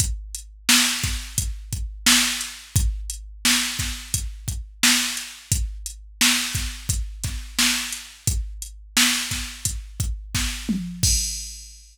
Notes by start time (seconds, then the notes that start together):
0.00 kick, closed hi-hat
0.35 closed hi-hat
0.69 snare
1.03 kick, snare, closed hi-hat
1.38 kick, closed hi-hat
1.73 kick, closed hi-hat
2.06 snare
2.41 closed hi-hat
2.76 kick, closed hi-hat
3.10 closed hi-hat
3.45 snare
3.79 kick, snare, closed hi-hat
4.14 kick, closed hi-hat
4.48 kick, closed hi-hat
4.83 snare
5.17 closed hi-hat
5.52 kick, closed hi-hat
5.86 closed hi-hat
6.21 snare
6.55 kick, snare, closed hi-hat
6.89 kick, closed hi-hat
7.24 kick, snare, closed hi-hat
7.59 snare
7.93 closed hi-hat
8.27 kick, closed hi-hat
8.62 closed hi-hat
8.97 snare
9.31 kick, snare, closed hi-hat
9.65 kick, closed hi-hat
10.00 kick, closed hi-hat
10.35 kick, snare
10.69 mid tom
11.03 kick, crash